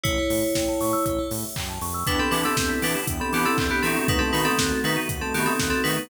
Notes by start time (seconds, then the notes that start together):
0.04 A1 E4 G4 C#5, kick, closed hi-hat
0.18 A4
0.30 A2 C#5, open hi-hat
0.43 E5
0.55 A1 G5, kick, snare
0.68 A5
0.81 A2 C#6, open hi-hat
0.93 E6
1.06 A1 G4, kick, closed hi-hat
1.18 A4
1.31 A2 C#5, open hi-hat
1.44 E5
1.56 F#2 G5, kick, clap
1.69 A5
1.81 F2 C#6, open hi-hat
1.94 E6
2.06 E2 B3 D4 E4 G4 B4 G5, kick, closed hi-hat
2.19 C4 A4 B5
2.31 E3 B3 D4 E4 G4 B4 D6, open hi-hat
2.45 C4 A4 E6
2.57 E2 G6, kick, snare
2.69 B6
2.82 E3 B3 D4 E4 G4 B4 D7, open hi-hat
2.95 E7
3.07 E2 G5, kick, closed hi-hat
3.20 C4 A4 B5
3.32 E3 B3 D4 E4 G4 D6, open hi-hat
3.45 C4 A4 E6
3.58 E2 G6, kick, clap
3.70 B3 G4 B6
3.82 E3 A3 B3 C4 D#4 F#4 A4 D7, open hi-hat
3.96 E7
4.08 D#2 A3 B3 D#4 F#4 B4 F#5, kick, closed hi-hat
4.19 C4 A4 A5
4.33 D#3 A3 B3 D#4 F#4 B4 B5, open hi-hat
4.45 C4 A4 D#6
4.59 D#2 F#6, kick, snare
4.72 A6
4.84 D#3 A3 B3 D#4 F#4 B4 B6, open hi-hat
4.96 D#7
5.09 D#2 F#5, kick, closed hi-hat
5.21 C4 A4 A5
5.34 D#3 A3 B3 D#4 F#4 G4 B5, open hi-hat
5.46 C4 A4 D#6
5.59 D#2 F#6, kick, snare
5.70 C4 A4 A6
5.84 D#3 A3 B3 D#4 F#4 B4 B6, open hi-hat
5.97 D#7